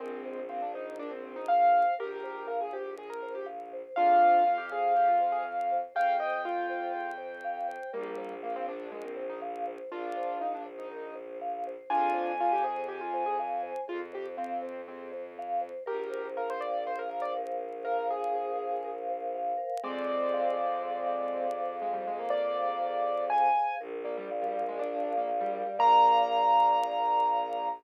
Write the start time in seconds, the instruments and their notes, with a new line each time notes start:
0.00 violin A#1, acoustic grand piano G#3 C4, vibraphone A#4
0.25 vibraphone C5
0.49 acoustic grand piano C4, vibraphone F5
0.62 acoustic grand piano D4
0.74 acoustic grand piano D#4, vibraphone C5
0.98 acoustic grand piano D4, vibraphone A#4
1.11 acoustic grand piano C4
1.23 vibraphone C5
1.36 acoustic grand piano D#4
1.48 vibraphone F5, acoustic grand piano F5
1.72 vibraphone C5
1.99 violin A#1, acoustic grand piano G4 A#4, vibraphone A#4
2.23 vibraphone C5
2.47 acoustic grand piano A#4, vibraphone F5
2.61 acoustic grand piano G#4
2.73 acoustic grand piano G4, vibraphone C5
2.97 acoustic grand piano G#4, vibraphone A#4
3.10 acoustic grand piano A#4
3.23 vibraphone C5
3.35 acoustic grand piano G4
3.46 vibraphone F5
3.73 vibraphone C5
3.96 violin F2, acoustic grand piano D4 F4 F5, vibraphone G#4
4.22 vibraphone C5
4.45 acoustic grand piano F4, vibraphone F5
4.58 acoustic grand piano G4
4.72 acoustic grand piano G#4, vibraphone C5
4.96 acoustic grand piano G4, vibraphone G#4
5.08 acoustic grand piano F4
5.20 vibraphone C5
5.32 acoustic grand piano G#4
5.44 vibraphone F5
5.71 vibraphone C5
5.95 violin F2, vibraphone G#4, acoustic grand piano F5 G5
6.20 vibraphone C5, acoustic grand piano D#5
6.45 acoustic grand piano F4, vibraphone F5
6.69 vibraphone C5
6.95 vibraphone G#4
7.18 vibraphone C5
7.44 vibraphone F5
7.68 vibraphone C5
7.93 violin A#1, acoustic grand piano G3 A#3, vibraphone A#4
8.17 vibraphone C5
8.43 acoustic grand piano A#3, vibraphone F5
8.56 acoustic grand piano C4
8.67 acoustic grand piano D4, vibraphone C5
8.92 acoustic grand piano G#3, vibraphone A#4
9.04 acoustic grand piano C4
9.17 vibraphone C5
9.29 acoustic grand piano D#4
9.42 vibraphone F5
9.67 vibraphone C5
9.92 violin A#1, acoustic grand piano D4 F4, vibraphone A#4
10.17 vibraphone C5
10.40 acoustic grand piano D#4, vibraphone F5
10.54 acoustic grand piano D4
10.66 vibraphone C5
10.79 acoustic grand piano D#4
10.91 vibraphone A#4
11.15 vibraphone C5
11.41 vibraphone F5
11.67 vibraphone C5
11.90 violin F2, acoustic grand piano D4 F4 G#5, vibraphone G#4
12.14 vibraphone C5
12.40 acoustic grand piano F4, vibraphone F5
12.52 acoustic grand piano G4
12.64 acoustic grand piano G#4, vibraphone C5
12.88 acoustic grand piano G4, vibraphone G#4
13.01 acoustic grand piano F4
13.14 vibraphone C5
13.26 acoustic grand piano G#4
13.39 vibraphone F5
13.63 vibraphone C5
13.88 violin F2, acoustic grand piano F4, vibraphone G#4
14.13 acoustic grand piano G4, vibraphone C5
14.37 acoustic grand piano C4, vibraphone F5
14.62 vibraphone C5
14.88 acoustic grand piano C4, vibraphone G#4
15.12 vibraphone C5
15.39 vibraphone F5
15.61 vibraphone C5
15.86 violin A#1, acoustic grand piano G4 A#4, vibraphone A#4
16.10 vibraphone C5
16.37 acoustic grand piano A#4, vibraphone F5
16.50 acoustic grand piano C5
16.61 vibraphone A#4, acoustic grand piano D5
16.86 vibraphone C5, acoustic grand piano C5
16.99 acoustic grand piano A#4
17.10 vibraphone F5
17.22 acoustic grand piano D5
17.36 vibraphone A#4
17.61 vibraphone C5
17.85 acoustic grand piano A#4, vibraphone F5
18.10 acoustic grand piano G#4, vibraphone A#4
18.35 vibraphone C5
18.59 vibraphone F5
18.84 vibraphone A#4
19.08 vibraphone C5
19.35 vibraphone F5
19.57 vibraphone A#4
19.84 violin F2, acoustic grand piano G#3 C4 D5, vibraphone G#4
20.08 vibraphone C5
20.33 vibraphone F5
20.57 vibraphone G#4
20.83 vibraphone C5
21.06 vibraphone F5
21.34 vibraphone G#4
21.57 vibraphone C5
21.82 acoustic grand piano G#3, vibraphone F5
21.93 acoustic grand piano G3
22.07 acoustic grand piano G#3, vibraphone G#4
22.19 acoustic grand piano A#3
22.30 vibraphone C5, acoustic grand piano D5
22.56 vibraphone F5
22.81 vibraphone G#4
23.04 vibraphone C5
23.30 vibraphone F5, acoustic grand piano G#5
23.56 vibraphone G#4
23.80 violin A#1, vibraphone A#4
24.04 acoustic grand piano A#3, vibraphone D5
24.17 acoustic grand piano G3
24.31 vibraphone F5
24.42 acoustic grand piano G3
24.53 vibraphone A#4
24.68 acoustic grand piano G#3
24.79 acoustic grand piano D4, vibraphone D5
25.04 vibraphone F5
25.18 acoustic grand piano A#3
25.28 vibraphone A#4
25.40 acoustic grand piano G3
25.54 vibraphone D5
25.66 acoustic grand piano G3
25.79 violin A#1, acoustic grand piano A#3 A#5, vibraphone A#4 D5 F5